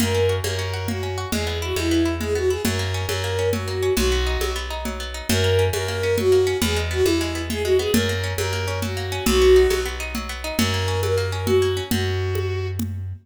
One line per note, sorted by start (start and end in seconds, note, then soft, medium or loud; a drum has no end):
0.00 0.41 F#2 medium
0.00 0.43 A#3 medium
0.00 0.35 A#4 medium
0.00 low conga loud
0.15 0.58 C#4 medium
0.29 0.73 F#4 medium
0.44 1.25 F#2 medium
0.44 0.88 A#3 medium
0.44 0.87 A#4 loud
0.44 high conga medium
0.59 1.02 C#4 medium
0.73 1.17 F#4 medium
0.88 1.30 A#3 medium
0.88 1.28 F#4 medium
0.88 low conga loud
1.03 1.31 C#4 medium
1.18 1.32 F#4 medium
1.32 1.73 E2 medium
1.32 1.76 G#3 medium
1.32 1.58 G#4 loud
1.32 low conga loud
1.47 1.91 B3 medium
1.62 2.05 E4 medium
1.62 1.75 F#4 loud
1.76 2.57 E2 medium
1.76 2.20 G#3 medium
1.76 2.15 E4 medium
1.76 high conga medium
1.91 2.35 B3 medium
2.05 2.50 E4 medium
2.21 2.63 G#3 medium
2.21 2.34 G#4 medium
2.21 low conga medium
2.35 2.63 B3 medium
2.35 2.50 F#4 medium
2.50 2.64 E4 medium
2.50 2.62 G#4 medium
2.65 3.06 F#2 medium
2.65 3.08 F#3 medium
2.65 3.06 A#4 medium
2.65 low conga loud
2.79 3.23 A#3 medium
2.94 3.38 C#4 medium
3.08 3.90 F#2 medium
3.08 3.53 F#3 medium
3.08 3.49 A#4 medium
3.08 high conga loud
3.24 3.67 A#3 medium
3.39 3.82 C#4 medium
3.52 3.95 F#3 medium
3.52 3.93 F#4 medium
3.52 low conga loud
3.68 3.96 A#3 medium
3.83 3.97 C#4 medium
3.96 4.38 B1 medium
3.96 4.40 F#3 medium
3.96 4.53 F#4 loud
3.96 low conga loud
4.12 4.55 B3 medium
4.27 4.70 D#4 medium
4.41 5.22 B1 medium
4.41 4.85 F#3 medium
4.41 high conga loud
4.56 4.99 B3 medium
4.70 5.14 D#4 medium
4.85 5.27 F#3 medium
4.85 low conga medium
5.00 5.28 B3 medium
5.14 5.28 D#4 medium
5.29 5.70 F#2 loud
5.29 5.73 F#3 loud
5.29 5.65 A#4 loud
5.29 low conga loud
5.44 5.88 A#3 medium
5.59 6.03 C#4 medium
5.73 6.54 F#2 medium
5.73 6.17 F#3 medium
5.73 6.16 A#4 loud
5.73 high conga loud
5.88 6.32 A#3 medium
6.03 6.46 C#4 medium
6.18 6.60 F#3 medium
6.18 6.57 F#4 loud
6.18 low conga loud
6.32 6.60 A#3 medium
6.47 6.61 C#4 medium
6.62 7.02 E2 medium
6.62 7.06 E3 medium
6.62 6.78 G#4 loud
6.62 low conga loud
6.76 7.20 G#3 medium
6.91 7.35 B3 medium
6.91 7.04 F#4 loud
7.04 7.87 E2 medium
7.04 7.50 E3 medium
7.04 7.42 E4 loud
7.04 high conga loud
7.21 7.64 G#3 medium
7.35 7.79 B3 medium
7.50 7.92 E3 medium
7.50 7.62 G#4 loud
7.50 low conga loud
7.64 7.93 G#3 medium
7.64 7.78 F#4 loud
7.79 7.93 B3 medium
7.79 7.92 G#4 loud
7.93 8.34 F#2 medium
7.93 8.38 F#3 medium
7.93 8.33 A#4 loud
7.93 low conga loud
8.09 8.52 A#3 medium
8.24 8.67 C#4 medium
8.38 9.19 F#2 medium
8.38 8.82 F#3 medium
8.38 8.79 A#4 loud
8.38 high conga loud
8.53 8.96 A#3 medium
8.68 9.11 C#4 medium
8.82 9.24 F#3 medium
8.82 9.24 F#4 medium
8.82 low conga medium
8.97 9.25 A#3 medium
9.12 9.26 C#4 medium
9.26 9.67 B1 medium
9.26 9.70 F#3 medium
9.26 9.83 F#4 loud
9.26 low conga loud
9.42 9.85 B3 medium
9.56 9.99 D#4 medium
9.70 10.52 B1 medium
9.70 10.14 F#3 medium
9.70 high conga loud
9.86 10.29 B3 medium
10.00 10.44 D#4 medium
10.15 10.57 F#3 medium
10.15 low conga medium
10.29 10.57 B3 medium
10.44 10.58 D#4 medium
10.57 11.81 F#2 medium
10.57 11.03 F#3 medium
10.57 11.00 A#4 loud
10.57 low conga loud
10.74 11.17 A#3 medium
10.88 11.32 C#4 medium
11.03 11.47 F#3 medium
11.03 11.47 A#4 medium
11.03 high conga loud
11.18 11.62 A#3 medium
11.32 11.76 C#4 medium
11.46 11.89 F#3 medium
11.46 11.83 F#4 loud
11.46 low conga loud
11.62 11.90 A#3 medium
11.77 11.91 C#4 medium
11.91 13.13 F#2 medium
11.91 12.68 F#4 loud
11.91 low conga loud
12.35 high conga medium
12.79 low conga loud